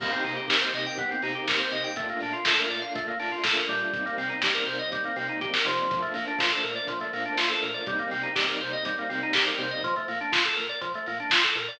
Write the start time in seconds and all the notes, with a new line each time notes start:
0.00 C2 A#3 C4 D#4 G4, kick, crash
0.12 C4, closed hi-hat
0.24 C3 D#4, open hi-hat
0.36 G4, closed hi-hat
0.48 C2 A#4, kick, snare
0.61 C5, closed hi-hat
0.74 C3 D#5, open hi-hat
0.86 G5, closed hi-hat
0.98 C2 B3, kick, closed hi-hat
1.11 C4, closed hi-hat
1.22 C3 D#4, open hi-hat
1.35 G4, closed hi-hat
1.48 C2 A#4, kick, snare
1.59 C5, closed hi-hat
1.71 C3 D#5, open hi-hat
1.84 G5, closed hi-hat
1.96 A#1 A3 A#3 D4 F4, kick, closed hi-hat
2.09 A#3, closed hi-hat
2.20 A#2 D4, open hi-hat
2.33 F4, closed hi-hat
2.45 A#1 A4, kick, snare
2.59 A#4, closed hi-hat
2.70 A#2 D5, open hi-hat
2.82 F5, closed hi-hat
2.95 A#1 A3, kick, closed hi-hat
3.08 A#3, closed hi-hat
3.20 A#2 D4, open hi-hat
3.32 F4
3.44 A#1 A4, kick, snare, closed hi-hat
3.56 A#4, closed hi-hat
3.68 A#2 G3, open hi-hat
3.81 closed hi-hat
3.93 C2 G3 A#3 C4 D#4, kick, closed hi-hat
4.06 A#3, closed hi-hat
4.17 C3 C4, open hi-hat
4.30 D#4, closed hi-hat
4.42 C2 G4, kick, snare
4.54 A#4, closed hi-hat
4.66 C3 C5, open hi-hat
4.79 D#5, closed hi-hat
4.92 C2 G3, kick, closed hi-hat
5.04 A#3, closed hi-hat
5.16 C3 C4, open hi-hat
5.28 D#4, closed hi-hat
5.41 B1 G4, kick, closed hi-hat
5.54 A#4, snare
5.65 C3 F3, open hi-hat
5.78 closed hi-hat
5.90 A#1 F3 A3 A#3 D4, kick, closed hi-hat
6.02 A3, closed hi-hat
6.14 A#2 A#3, open hi-hat
6.28 D4, closed hi-hat
6.39 A#1 F4, kick, snare
6.52 A4
6.64 A#2 A#4, open hi-hat
6.76 D5, closed hi-hat
6.87 A#1 F3, kick, closed hi-hat
7.00 A3, closed hi-hat
7.13 A#2 A#3, open hi-hat
7.25 D4, closed hi-hat
7.37 A#1 F4, snare
7.50 A4, closed hi-hat
7.62 A#2 A#4, open hi-hat
7.74 D5, closed hi-hat
7.86 C2 G3 A#3 C4 D#4, kick, closed hi-hat
7.99 A#3, closed hi-hat
8.11 C3 C4, open hi-hat
8.23 D#4, closed hi-hat
8.35 C2 G4, kick, snare
8.48 A#4, closed hi-hat
8.61 C3 C5, open hi-hat
8.72 D#5, closed hi-hat
8.85 C2 G3, kick, closed hi-hat
8.98 A#3, closed hi-hat
9.09 C3 C4, open hi-hat
9.23 D#4, closed hi-hat
9.33 C2 G4, kick, snare
9.45 A#4, closed hi-hat
9.58 C3 C5, open hi-hat
9.71 D#5, closed hi-hat
9.83 A#1 F3, kick, closed hi-hat
9.96 A3, closed hi-hat
10.08 A#2 A#3, open hi-hat
10.21 D4, closed hi-hat
10.32 A#1 F4, kick, snare
10.44 A4, closed hi-hat
10.56 A#2 A#4, open hi-hat
10.69 D5, closed hi-hat
10.81 A#1 F3, kick, closed hi-hat
10.94 A3, closed hi-hat
11.06 A#2 A#3, open hi-hat
11.20 D4, closed hi-hat
11.30 A#1 F4, kick, snare
11.43 A4, closed hi-hat
11.55 A#2 A#4, open hi-hat
11.68 D5, open hi-hat